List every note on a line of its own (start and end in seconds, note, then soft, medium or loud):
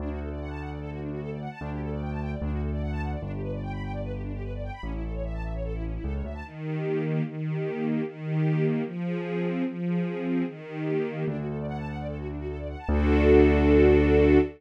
0.00 1.48 D2 medium
0.00 0.09 D4 loud
0.10 0.19 F#4 medium
0.20 0.29 A4 medium
0.30 0.39 D5 medium
0.40 0.49 F#5 medium
0.50 0.59 A5 medium
0.60 0.69 F#5 medium
0.71 0.80 D5 medium
0.81 0.90 A4 loud
0.91 1.00 F#4 medium
1.01 1.10 D4 medium
1.11 1.20 F#4 medium
1.21 1.30 A4 loud
1.31 1.40 D5 medium
1.41 1.50 F#5 medium
1.51 1.60 A5 medium
1.61 2.35 D2 medium
1.61 1.70 D4 loud
1.71 1.80 G4 medium
1.81 1.90 A4 medium
1.91 2.00 D5 medium
2.01 2.10 G5 medium
2.11 2.20 A5 medium
2.21 2.31 G5 medium
2.32 2.41 D5 medium
2.42 3.16 D2 medium
2.42 2.51 D4 loud
2.52 2.61 F#4 medium
2.62 2.71 A4 medium
2.72 2.81 D5 loud
2.82 2.91 F#5 medium
2.92 3.01 A5 loud
3.02 3.11 F#5 medium
3.12 3.21 D5 medium
3.22 4.70 G1 medium
3.22 3.31 D4 loud
3.32 3.41 G4 medium
3.42 3.51 B4 medium
3.52 3.61 D5 medium
3.63 3.72 G5 medium
3.72 3.82 B5 medium
3.83 3.92 G5 medium
3.93 4.02 D5 medium
4.03 4.12 B4 loud
4.13 4.22 G4 medium
4.23 4.32 D4 medium
4.33 4.42 G4 medium
4.43 4.52 B4 medium
4.53 4.62 D5 medium
4.63 4.72 G5 medium
4.73 4.82 B5 medium
4.83 5.98 A1 medium
4.83 4.92 C#4 loud
4.93 5.02 E4 medium
5.03 5.12 A4 medium
5.13 5.22 C#5 medium
5.24 5.33 E5 medium
5.34 5.43 A5 medium
5.44 5.53 E5 medium
5.54 5.63 C#5 medium
5.64 5.73 A4 medium
5.74 5.83 E4 loud
5.84 5.93 C#4 medium
5.94 6.03 E4 medium
6.04 6.22 C#2 medium
6.04 6.13 A4 loud
6.14 6.23 C#5 medium
6.24 6.42 D2 medium
6.24 6.33 E5 medium
6.34 6.43 A5 medium
6.44 7.21 D#3 medium
6.64 7.04 G4 medium
6.85 7.23 A#3 medium
7.05 7.24 G4 medium
7.25 8.01 D#3 medium
7.45 7.85 G4 medium
7.65 8.03 A#3 medium
7.85 8.04 G4 medium
8.05 8.82 D#3 medium
8.26 8.65 G4 medium
8.46 8.84 A#3 medium
8.66 8.85 G4 medium
8.86 9.62 F3 medium
9.06 9.46 G#4 medium
9.26 9.65 C4 medium
9.46 9.66 G#4 medium
9.66 10.43 F3 medium
9.87 10.26 G#4 medium
10.07 10.45 C4 medium
10.27 10.46 G#4 medium
10.47 11.24 D#3 medium
10.67 11.07 G4 medium
10.87 11.26 A#3 medium
11.07 11.27 G4 medium
11.28 12.76 D2 medium
11.28 11.37 D4 loud
11.38 11.47 F#4 medium
11.48 11.57 A4 medium
11.58 11.67 D5 medium
11.68 11.77 F#5 loud
11.78 11.87 A5 medium
11.88 11.97 F#5 medium
11.98 12.07 D5 medium
12.08 12.17 A4 medium
12.18 12.27 F#4 medium
12.28 12.37 D4 medium
12.38 12.47 F#4 medium
12.48 12.57 A4 medium
12.58 12.67 D5 medium
12.69 12.78 F#5 medium
12.78 12.88 A5 medium
12.89 14.39 D2 loud
12.89 14.39 D4 loud
12.89 14.39 F#4 loud
12.89 14.39 A4 loud